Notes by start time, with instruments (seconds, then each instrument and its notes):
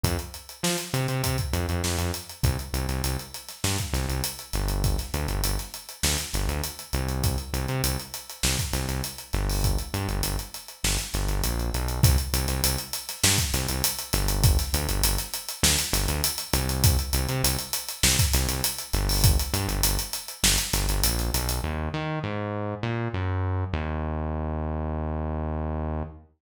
0.04 synth bass 1 F2, kick, closed hi-hat
0.19 closed hi-hat
0.34 closed hi-hat
0.49 closed hi-hat
0.63 synth bass 1 F3, snare
0.78 closed hi-hat
0.93 synth bass 1 C3, closed hi-hat
1.08 synth bass 1 C3, closed hi-hat
1.23 synth bass 1 C3, kick, closed hi-hat
1.38 kick, closed hi-hat
1.53 synth bass 1 F2, closed hi-hat
1.69 synth bass 1 F2, closed hi-hat
1.84 synth bass 1 F2, snare
1.98 synth bass 1 F2, closed hi-hat
2.14 closed hi-hat
2.29 closed hi-hat
2.43 synth bass 1 C2, kick, closed hi-hat
2.59 closed hi-hat
2.73 synth bass 1 C2, closed hi-hat
2.88 synth bass 1 C2, snare, closed hi-hat
3.04 synth bass 1 C2, closed hi-hat
3.19 closed hi-hat
3.34 closed hi-hat
3.48 snare, closed hi-hat
3.64 synth bass 1 G2, snare
3.78 kick, closed hi-hat
3.93 synth bass 1 C2, snare, closed hi-hat
4.09 synth bass 1 C2, closed hi-hat
4.24 closed hi-hat
4.39 closed hi-hat
4.53 synth bass 1 G1, snare, closed hi-hat
4.68 closed hi-hat
4.84 kick, closed hi-hat
4.98 snare, closed hi-hat
5.14 synth bass 1 D2, closed hi-hat
5.28 synth bass 1 G1, closed hi-hat
5.43 synth bass 1 G1, closed hi-hat
5.59 snare, closed hi-hat
5.74 closed hi-hat
5.89 closed hi-hat
6.03 synth bass 1 D2, snare
6.18 closed hi-hat
6.33 synth bass 1 G1, snare, closed hi-hat
6.49 synth bass 1 D2, closed hi-hat
6.64 closed hi-hat
6.79 closed hi-hat
6.93 synth bass 1 C2, closed hi-hat
7.08 closed hi-hat
7.24 kick, closed hi-hat
7.38 closed hi-hat
7.53 synth bass 1 C2, closed hi-hat
7.68 synth bass 1 C3, closed hi-hat
7.84 synth bass 1 C2, closed hi-hat
8.00 closed hi-hat
8.14 closed hi-hat
8.29 closed hi-hat
8.43 synth bass 1 C2, snare
8.59 kick, closed hi-hat
8.73 synth bass 1 C2, snare, closed hi-hat
8.88 synth bass 1 C2, snare, closed hi-hat
9.04 closed hi-hat
9.18 closed hi-hat
9.33 synth bass 1 G1, snare, closed hi-hat
9.50 open hi-hat
9.64 kick, closed hi-hat
9.79 closed hi-hat
9.94 synth bass 1 G2, closed hi-hat
10.09 synth bass 1 G1, closed hi-hat
10.23 synth bass 1 G1, closed hi-hat
10.39 closed hi-hat
10.54 closed hi-hat
10.68 closed hi-hat
10.84 synth bass 1 G1, snare
10.98 snare, closed hi-hat
11.14 synth bass 1 G1, snare, closed hi-hat
11.29 synth bass 1 G1, closed hi-hat
11.44 synth bass 1 A#1, closed hi-hat
11.60 closed hi-hat
11.73 synth bass 1 B1, closed hi-hat
11.88 closed hi-hat
12.03 synth bass 1 C2, kick, closed hi-hat
12.18 closed hi-hat
12.33 synth bass 1 C2, closed hi-hat
12.48 synth bass 1 C2, snare, closed hi-hat
12.63 synth bass 1 C2, closed hi-hat
12.79 closed hi-hat
12.93 closed hi-hat
13.09 snare, closed hi-hat
13.23 synth bass 1 G2, snare
13.38 kick, closed hi-hat
13.53 synth bass 1 C2, snare, closed hi-hat
13.69 synth bass 1 C2, closed hi-hat
13.84 closed hi-hat
13.99 closed hi-hat
14.13 synth bass 1 G1, snare, closed hi-hat
14.28 closed hi-hat
14.44 kick, closed hi-hat
14.59 snare, closed hi-hat
14.73 synth bass 1 D2, closed hi-hat
14.88 synth bass 1 G1, closed hi-hat
15.03 synth bass 1 G1, closed hi-hat
15.18 snare, closed hi-hat
15.34 closed hi-hat
15.49 closed hi-hat
15.63 synth bass 1 D2, snare
15.79 closed hi-hat
15.93 synth bass 1 G1, snare, closed hi-hat
16.08 synth bass 1 D2, closed hi-hat
16.24 closed hi-hat
16.38 closed hi-hat
16.53 synth bass 1 C2, closed hi-hat
16.69 closed hi-hat
16.84 kick, closed hi-hat
16.99 closed hi-hat
17.13 synth bass 1 C2, closed hi-hat
17.29 synth bass 1 C3, closed hi-hat
17.43 synth bass 1 C2, closed hi-hat
17.59 closed hi-hat
17.73 closed hi-hat
17.89 closed hi-hat
18.03 synth bass 1 C2, snare
18.19 kick, closed hi-hat
18.34 synth bass 1 C2, snare, closed hi-hat
18.48 synth bass 1 C2, snare, closed hi-hat
18.64 closed hi-hat
18.79 closed hi-hat
18.93 synth bass 1 G1, snare, closed hi-hat
19.09 open hi-hat
19.24 kick, closed hi-hat
19.39 closed hi-hat
19.53 synth bass 1 G2, closed hi-hat
19.68 synth bass 1 G1, closed hi-hat
19.83 synth bass 1 G1, closed hi-hat
19.99 closed hi-hat
20.13 closed hi-hat
20.28 closed hi-hat
20.43 synth bass 1 G1, snare
20.58 snare, closed hi-hat
20.73 synth bass 1 G1, snare, closed hi-hat
20.88 synth bass 1 G1, closed hi-hat
21.04 synth bass 1 A#1, closed hi-hat
21.19 closed hi-hat
21.33 synth bass 1 B1, closed hi-hat
21.49 closed hi-hat
21.64 synth bass 1 D#2
21.94 synth bass 1 D#3
22.24 synth bass 1 G#2
22.83 synth bass 1 A#2
23.14 synth bass 1 F#2
23.73 synth bass 1 D#2